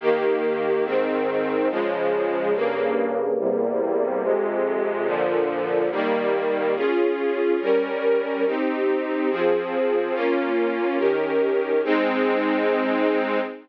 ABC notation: X:1
M:4/4
L:1/8
Q:1/4=142
K:Ab
V:1 name="String Ensemble 1"
[E,B,G]4 [A,,E,C]4 | [D,F,A,]4 [G,,D,B,]4 | [=E,,C,G,B,]4 [F,,C,A,]4 | [B,,=D,F,]4 [E,G,B,]4 |
[DFA]4 [G,DB]4 | [CEG]4 [F,CA]4 | [B,DF]4 [E,DGB]4 | [A,CE]8 |]